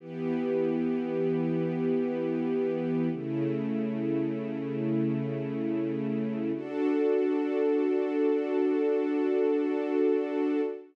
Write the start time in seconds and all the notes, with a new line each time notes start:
0.00 E3 B3 G4
3.12 C#3 A3 E4
6.55 D4 F#4 A4